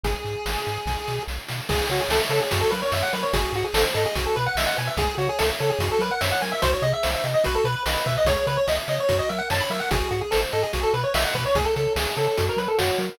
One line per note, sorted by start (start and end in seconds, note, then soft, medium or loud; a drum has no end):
0.04 0.15 G#1 loud
0.04 1.23 G#4 medium
0.04 kick medium
0.04 closed hi-hat medium
0.25 0.36 G#2 medium
0.25 closed hi-hat medium
0.46 0.57 G#1 medium
0.46 snare medium
0.66 0.78 G#2 medium
0.66 closed hi-hat medium
0.86 0.97 B1 medium
0.86 kick medium
0.86 snare medium
1.08 1.19 B2 medium
1.08 snare medium
1.28 1.39 B1 medium
1.28 snare medium
1.48 1.61 B2 medium
1.48 snare medium
1.69 1.81 C#2 medium
1.69 1.90 G#4 loud
1.69 1.87 G#4 medium
1.69 kick loud
1.69 crash loud
1.90 2.01 C#3 medium
1.90 2.01 F#4 medium
1.90 2.10 C#5 medium
1.90 closed hi-hat medium
2.00 2.10 G#4 medium
2.09 2.20 C#2 medium
2.09 2.21 A4 medium
2.09 2.31 E5 medium
2.09 snare loud
2.29 2.41 C#3 medium
2.29 2.40 A4 medium
2.29 2.50 C#5 medium
2.29 closed hi-hat medium
2.41 2.60 G#4 medium
2.51 2.64 F#2 loud
2.51 2.72 F#4 loud
2.51 kick medium
2.51 closed hi-hat loud
2.61 2.71 A4 medium
2.70 2.83 F#3 medium
2.70 2.92 A#4 medium
2.70 2.80 B4 medium
2.70 closed hi-hat medium
2.82 2.92 C#5 medium
2.92 3.03 F#2 medium
2.92 3.13 C#5 medium
2.92 3.03 E5 medium
2.92 snare medium
3.02 3.12 F#5 medium
3.13 3.24 F#3 medium
3.13 3.32 A#4 medium
3.13 3.23 B4 medium
3.13 closed hi-hat medium
3.23 3.32 C#5 medium
3.33 3.45 G#1 loud
3.33 3.54 F#4 loud
3.33 3.52 G#4 medium
3.33 kick loud
3.33 closed hi-hat loud
3.53 3.64 G#2 medium
3.53 3.65 F#4 medium
3.53 3.75 G#4 medium
3.53 closed hi-hat medium
3.64 3.74 G#4 medium
3.74 3.85 G#1 medium
3.74 3.84 A4 medium
3.74 3.95 C5 medium
3.74 snare loud
3.94 4.06 G#2 loud
3.94 4.04 A4 medium
3.94 4.15 D#5 loud
3.94 closed hi-hat medium
4.06 4.25 G#4 medium
4.15 4.27 B1 medium
4.15 4.36 F#4 loud
4.15 kick medium
4.15 closed hi-hat loud
4.26 4.35 A4 medium
4.36 4.48 B2 medium
4.36 4.45 B4 medium
4.36 4.57 B4 loud
4.36 closed hi-hat medium
4.46 4.56 F#5 medium
4.55 4.67 B1 medium
4.55 4.77 D#5 medium
4.55 4.67 E5 medium
4.55 snare loud
4.66 4.76 F#5 medium
4.77 4.89 B2 medium
4.77 4.96 B4 medium
4.77 4.88 G#5 medium
4.77 closed hi-hat medium
4.87 4.97 E5 medium
4.97 5.08 C#2 loud
4.97 5.18 G#4 loud
4.97 5.15 G#4 medium
4.97 kick loud
4.97 closed hi-hat loud
5.18 5.29 C#3 medium
5.18 5.27 F#4 medium
5.18 5.39 C#5 medium
5.18 closed hi-hat medium
5.29 5.39 G#4 medium
5.39 5.52 C#2 medium
5.39 5.49 A4 medium
5.39 5.59 E5 medium
5.39 snare loud
5.59 5.72 C#3 medium
5.59 5.70 A4 medium
5.59 5.79 C#5 loud
5.59 closed hi-hat medium
5.70 5.88 G#4 medium
5.79 5.90 F#2 loud
5.79 6.00 F#4 loud
5.79 kick medium
5.79 closed hi-hat loud
5.92 6.01 A4 medium
5.99 6.10 F#3 medium
5.99 6.21 A#4 medium
5.99 6.11 B4 medium
5.99 closed hi-hat medium
6.11 6.21 F#5 medium
6.21 6.33 F#2 medium
6.21 6.42 C#5 medium
6.21 6.30 E5 medium
6.21 snare loud
6.31 6.41 F#5 medium
6.41 6.54 F#3 medium
6.41 6.61 A#4 medium
6.41 6.51 G#5 medium
6.41 open hi-hat medium
6.52 6.61 E5 medium
6.62 6.74 C2 loud
6.62 6.82 F#4 loud
6.62 6.71 C5 medium
6.62 kick loud
6.62 closed hi-hat loud
6.73 6.83 C#5 medium
6.82 6.93 C3 loud
6.82 7.04 G#4 medium
6.82 6.92 D#5 medium
6.82 closed hi-hat medium
6.93 7.11 E5 medium
7.03 7.16 C2 medium
7.03 7.24 C5 medium
7.03 snare loud
7.14 7.24 E5 medium
7.24 7.35 C3 medium
7.24 7.43 D#5 medium
7.24 closed hi-hat medium
7.34 7.44 D#5 medium
7.44 7.58 B1 loud
7.44 7.65 F#4 loud
7.44 7.55 B4 medium
7.44 kick medium
7.44 closed hi-hat medium
7.55 7.64 A4 medium
7.64 7.76 B2 medium
7.64 7.83 B4 medium
7.64 7.86 B4 loud
7.64 closed hi-hat medium
7.86 7.97 B1 medium
7.86 8.04 B4 medium
7.86 8.06 D#5 medium
7.86 snare loud
8.06 8.17 B2 loud
8.06 8.26 B4 loud
8.06 8.16 E5 medium
8.06 kick medium
8.06 closed hi-hat medium
8.17 8.27 D#5 medium
8.25 8.36 C#2 loud
8.25 8.47 G#4 loud
8.25 8.46 C#5 medium
8.25 kick loud
8.25 closed hi-hat loud
8.47 8.58 C#3 medium
8.47 8.57 B4 medium
8.47 8.67 C#5 loud
8.47 closed hi-hat medium
8.57 8.66 C#5 medium
8.68 8.79 C#2 medium
8.68 8.78 D#5 medium
8.68 8.88 E5 medium
8.68 snare medium
8.88 8.99 C#3 medium
8.88 9.08 C#5 medium
8.88 8.98 D#5 medium
8.88 closed hi-hat medium
9.00 9.17 C#5 medium
9.09 9.21 F#2 loud
9.09 9.29 F#4 loud
9.09 kick medium
9.09 closed hi-hat medium
9.19 9.28 D#5 medium
9.29 9.41 F#3 medium
9.29 9.50 A#4 medium
9.29 9.39 E5 medium
9.29 closed hi-hat medium
9.38 9.48 F#5 medium
9.50 9.62 F#2 medium
9.50 9.70 C#5 medium
9.50 9.61 A5 medium
9.50 snare loud
9.60 9.70 B5 medium
9.70 9.81 F#3 medium
9.70 9.90 A#4 medium
9.70 9.80 E5 medium
9.70 open hi-hat medium
9.80 9.89 F#5 medium
9.91 10.03 G#1 loud
9.91 10.11 F#4 loud
9.91 10.08 G#4 medium
9.91 kick loud
9.91 closed hi-hat loud
10.11 10.22 G#2 medium
10.11 10.20 F#4 medium
10.11 10.32 G#4 medium
10.11 closed hi-hat medium
10.21 10.31 G#4 medium
10.31 10.45 G#1 medium
10.31 10.41 A4 medium
10.31 10.52 C5 medium
10.31 snare loud
10.52 10.65 G#2 medium
10.52 10.63 A4 medium
10.52 10.72 D#5 loud
10.52 closed hi-hat medium
10.63 10.80 G#4 medium
10.73 10.85 B1 loud
10.73 10.94 F#4 loud
10.73 kick medium
10.73 closed hi-hat medium
10.83 10.93 A4 medium
10.93 11.05 B2 medium
10.93 11.03 B4 medium
10.93 11.14 B4 loud
10.93 closed hi-hat medium
11.03 11.13 C#5 medium
11.14 11.26 B1 medium
11.14 11.35 D#5 loud
11.14 11.24 E5 medium
11.14 snare loud
11.25 11.34 F#5 medium
11.35 11.46 B2 medium
11.35 11.44 B4 medium
11.35 11.55 B4 medium
11.35 kick medium
11.35 closed hi-hat medium
11.45 11.55 C#5 medium
11.55 11.66 C#2 loud
11.55 11.76 G#4 loud
11.55 11.65 G#4 medium
11.55 kick loud
11.55 closed hi-hat medium
11.65 11.74 A4 medium
11.76 11.88 C#3 medium
11.76 11.93 A4 medium
11.76 11.96 C#5 medium
11.76 closed hi-hat medium
11.96 12.07 C#2 loud
11.96 12.15 G#4 medium
11.96 12.17 E5 loud
11.96 snare loud
12.17 12.28 C#3 medium
12.17 12.27 A4 medium
12.17 12.37 C#5 medium
12.17 closed hi-hat medium
12.27 12.46 A4 medium
12.37 12.50 F#2 loud
12.37 12.58 F#4 loud
12.37 kick medium
12.37 closed hi-hat loud
12.49 12.59 A#4 medium
12.57 12.68 F#3 medium
12.57 12.78 A#4 medium
12.57 12.68 B4 medium
12.57 closed hi-hat medium
12.68 12.78 A4 medium
12.78 12.91 F#2 medium
12.78 13.18 F#4 medium
12.78 12.99 C#5 medium
12.78 snare loud
12.98 13.10 F#3 loud
12.98 13.18 A#4 medium
12.98 closed hi-hat medium